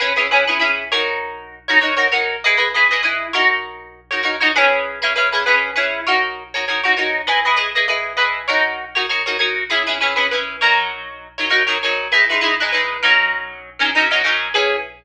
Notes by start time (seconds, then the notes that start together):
0.00 C#4 E4 G#4 B4
0.16 C#4 E4 G#4 B4
0.31 C#4 E4 G#4 B4
0.47 C#4 E4 G#4 B4
0.59 C#4 E4 G#4 B4
0.92 D#4 F#4 A#4 C#5
1.68 D#4 F#4 A#4 C#5
1.81 D#4 F#4 A#4 C#5
1.97 D#4 F#4 A#4 C#5
2.12 D#4 F#4 A#4 C#5
2.44 E4 G#4 B4 D#5
2.57 E4 G#4 B4 D#5
2.74 E4 G#4 B4 D#5
2.91 E4 G#4 B4 D#5
3.03 E4 G#4 B4 D#5
3.33 D#4 F#4 A#4 C#5
4.11 D#4 F#4 A#4 C#5
4.23 D#4 F#4 A#4 C#5
4.41 D#4 F#4 A#4 C#5
4.56 C#4 E4 G#4 B4
5.02 C#4 E4 G#4 B4
5.16 C#4 E4 G#4 B4
5.32 C#4 E4 G#4 B4
5.46 C#4 E4 G#4 B4
5.76 C#4 E4 G#4 B4
6.07 D#4 F#4 A#4 C#5
6.54 D#4 F#4 A#4 C#5
6.68 D#4 F#4 A#4 C#5
6.84 D#4 F#4 A#4 C#5
6.97 D#4 F#4 A#4 C#5
7.27 E4 G#4 B4 D#5
7.45 E4 G#4 B4 D#5
7.57 E4 G#4 B4 D#5
7.75 E4 G#4 B4 D#5
7.88 E4 G#4 B4 D#5
8.17 E4 G#4 B4 D#5
8.48 D#4 F#4 A#4 C#5
8.95 D#4 F#4 A#4 C#5
9.09 D#4 F#4 A#4 C#5
9.26 D#4 F#4 A#4 C#5
9.39 D#4 F#4 A#4 C#5
9.70 C#4 E4 G#4 B4
9.87 C#4 E4 G#4 B4
10.01 C#4 E4 G#4 B4
10.16 C#4 E4 G#4 B4
10.31 C#4 E4 G#4 B4
10.61 F#3 D#4 A#4 C#5
11.38 F#3 D#4 A#4 C#5
11.50 F#3 D#4 A#4 C#5
11.67 F#3 D#4 A#4 C#5
11.83 F#3 D#4 A#4 C#5
12.12 G#3 D#4 E4 B4
12.30 G#3 D#4 E4 B4
12.41 G#3 D#4 E4 B4
12.60 G#3 D#4 E4 B4
12.72 G#3 D#4 E4 B4
13.03 F#3 C#4 D#4 A#4
13.79 F#3 C#4 D#4 A#4
13.95 F#3 C#4 D#4 A#4
14.11 F#3 C#4 D#4 A#4
14.24 F#3 C#4 D#4 A#4
14.54 C#4 E4 G#4 B4